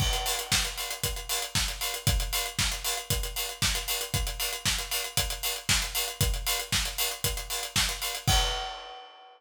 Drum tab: CC |x---------------|----------------|----------------|----------------|
HH |-xox-xoxxxox-xox|xxox-xoxxxox-xox|xxox-xoxxxox-xox|xxox-xoxxxox-xox|
SD |----o-------o---|----o-------o---|----o-------o---|----o-------o---|
BD |o---o---o---o---|o---o---o---o---|o---o---o---o---|o---o---o---o---|

CC |x---------------|
HH |----------------|
SD |----------------|
BD |o---------------|